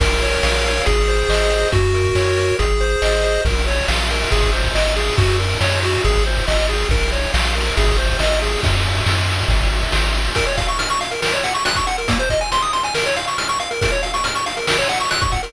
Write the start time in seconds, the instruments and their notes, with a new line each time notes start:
0.00 synth bass 1 A#1, lead 1 (square) A#4, kick, crash
0.22 lead 1 (square) C#5, closed hi-hat
0.43 synth bass 1 A#1, lead 1 (square) F5, snare
0.64 lead 1 (square) C#5, closed hi-hat
0.86 synth bass 1 G#1, lead 1 (square) G#4, kick, closed hi-hat
1.08 lead 1 (square) C5, closed hi-hat
1.29 synth bass 1 G#1, lead 1 (square) D#5, snare
1.50 lead 1 (square) C5, closed hi-hat
1.72 synth bass 1 F#2, lead 1 (square) F#4, kick, closed hi-hat
1.94 lead 1 (square) A#4, closed hi-hat
2.04 kick
2.15 synth bass 1 F#2, lead 1 (square) C#5, snare
2.37 lead 1 (square) A#4, closed hi-hat
2.59 synth bass 1 G#1, lead 1 (square) G#4, kick, closed hi-hat
2.80 lead 1 (square) C5, closed hi-hat
3.02 synth bass 1 G#1, lead 1 (square) D#5, snare
3.24 lead 1 (square) C5, closed hi-hat
3.45 synth bass 1 A#1, lead 1 (square) A#4, kick, crash
3.56 ride
3.67 lead 1 (square) C#5, ride
3.78 ride
3.88 synth bass 1 A#1, lead 1 (square) F5, snare
3.99 ride
4.10 lead 1 (square) A#4, ride
4.22 ride
4.31 synth bass 1 G#1, lead 1 (square) G#4, kick, ride
4.43 kick, ride
4.53 lead 1 (square) C5, ride
4.63 kick, ride
4.74 synth bass 1 G#1, lead 1 (square) D#5, snare
4.86 ride
4.96 lead 1 (square) G#4, ride
5.07 ride
5.18 synth bass 1 F#2, lead 1 (square) F#4, kick, ride
5.28 ride
5.40 lead 1 (square) A#4, ride
5.51 ride
5.61 synth bass 1 F#2, lead 1 (square) C#5, snare
5.72 ride
5.83 lead 1 (square) F#4, ride
5.94 ride
6.04 synth bass 1 G#1, lead 1 (square) G#4, kick, ride
6.15 kick, ride
6.26 lead 1 (square) C5, ride
6.37 kick, ride
6.48 synth bass 1 G#1, lead 1 (square) D#5, snare
6.58 ride
6.69 lead 1 (square) G#4, ride
6.80 ride
6.89 synth bass 1 A#1, lead 1 (square) A#4, kick, ride
7.02 ride
7.12 lead 1 (square) C#5, ride
7.24 ride
7.34 synth bass 1 A#1, lead 1 (square) F5, snare
7.45 ride
7.55 lead 1 (square) A#4, ride
7.66 ride
7.77 synth bass 1 G#1, lead 1 (square) G#4, kick, ride
7.88 kick, ride
7.98 lead 1 (square) C5, ride
8.09 kick, ride
8.19 synth bass 1 G#1, lead 1 (square) D#5, snare
8.31 ride
8.42 lead 1 (square) G#4, ride
8.53 ride
8.63 synth bass 1 F#2, kick, ride
8.74 ride
8.85 ride
8.95 ride
9.06 synth bass 1 F#2, snare
9.17 ride
9.29 ride
9.39 ride
9.48 synth bass 1 G#1, kick, ride
9.60 kick, ride
9.72 ride
9.82 kick, ride
9.92 synth bass 1 G#1, snare
10.04 ride
10.14 ride
10.26 ride
10.35 lead 1 (square) A#4, kick, closed hi-hat
10.46 lead 1 (square) C#5, closed hi-hat
10.57 lead 1 (square) F5, kick, closed hi-hat
10.68 lead 1 (square) C#6, closed hi-hat
10.79 lead 1 (square) F6, closed hi-hat
10.90 lead 1 (square) C#6, closed hi-hat
11.01 lead 1 (square) F5, closed hi-hat
11.11 lead 1 (square) A#4, closed hi-hat
11.22 lead 1 (square) A#4, snare
11.32 lead 1 (square) C#5, closed hi-hat
11.43 lead 1 (square) F#5, closed hi-hat
11.55 lead 1 (square) C#6, closed hi-hat
11.65 lead 1 (square) F#6, closed hi-hat
11.76 lead 1 (square) C#6, kick, closed hi-hat
11.87 lead 1 (square) F#5, closed hi-hat
11.98 lead 1 (square) A#4, closed hi-hat
12.08 lead 1 (square) A#3, kick, closed hi-hat
12.19 lead 1 (square) C5, closed hi-hat
12.29 lead 1 (square) D#5, kick, closed hi-hat
12.41 lead 1 (square) G#5, closed hi-hat
12.52 lead 1 (square) C6, closed hi-hat
12.62 lead 1 (square) D#6, closed hi-hat
12.73 lead 1 (square) C6, closed hi-hat
12.83 lead 1 (square) G#5, closed hi-hat
12.94 lead 1 (square) A#4, snare
13.06 lead 1 (square) C#5, closed hi-hat
13.16 lead 1 (square) F5, closed hi-hat
13.27 lead 1 (square) C#6, closed hi-hat
13.38 lead 1 (square) F6, closed hi-hat
13.49 lead 1 (square) C#6, closed hi-hat
13.59 lead 1 (square) F5, closed hi-hat
13.71 lead 1 (square) A#4, closed hi-hat
13.81 lead 1 (square) A#4, kick, closed hi-hat
13.92 lead 1 (square) C#5, closed hi-hat
14.03 lead 1 (square) F5, closed hi-hat
14.14 lead 1 (square) C#6, closed hi-hat
14.24 lead 1 (square) F6, closed hi-hat
14.35 lead 1 (square) C#6, closed hi-hat
14.46 lead 1 (square) F5, closed hi-hat
14.57 lead 1 (square) A#4, closed hi-hat
14.67 lead 1 (square) A#4, snare
14.78 lead 1 (square) C#5, closed hi-hat
14.89 lead 1 (square) F#5, closed hi-hat
15.00 lead 1 (square) C#6, closed hi-hat
15.11 lead 1 (square) F#6, closed hi-hat
15.21 lead 1 (square) C#6, kick, closed hi-hat
15.32 lead 1 (square) F#5, kick, closed hi-hat
15.43 lead 1 (square) A#4, closed hi-hat